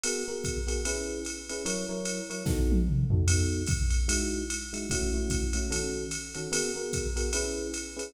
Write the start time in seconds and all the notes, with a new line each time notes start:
0.04 B3 F#4 G#4 A#4, ride
0.28 B3 F#4 G#4 A#4
0.44 kick, hi-hat pedal, ride
0.67 B3 F#4 G#4 A#4, ride
0.85 C#4 E4 G#4 B4, ride
1.25 hi-hat pedal, ride
1.49 C#4 E4 G#4 B4, ride
1.65 F#3 E4 A#4 C#5, ride
1.89 F#3 E4 A#4 C#5
2.05 hi-hat pedal, ride
2.30 F#3 E4 A#4 C#5, ride
2.46 B3 D#4 F#4 A4, kick, snare
2.72 high tom
2.88 mid tom
3.10 B3 D#4 F#4 A4, floor tom
3.28 B3 D#4 F#4 A4, ride
3.66 kick, hi-hat pedal, ride
3.90 ride
4.08 G#3 D#4 E4 F#4, ride
4.50 hi-hat pedal, ride
4.73 G#3 D#4 E4 F#4, ride
4.90 A3 C#4 E4 F#4, kick, ride
5.14 A3 C#4 E4 F#4
5.30 kick, hi-hat pedal, ride
5.53 A3 C#4 E4 F#4, ride
5.71 D#3 C#4 F#4 A4, ride
6.11 hi-hat pedal, ride
6.35 D#3 C#4 F#4 A4, ride
6.52 B3 F#4 G#4 A#4, ride
6.76 B3 F#4 G#4 A#4
6.93 kick, hi-hat pedal, ride
7.16 B3 F#4 G#4 A#4, ride
7.33 C#4 E4 G#4 B4, ride
7.74 hi-hat pedal, ride
7.97 C#4 E4 G#4 B4, ride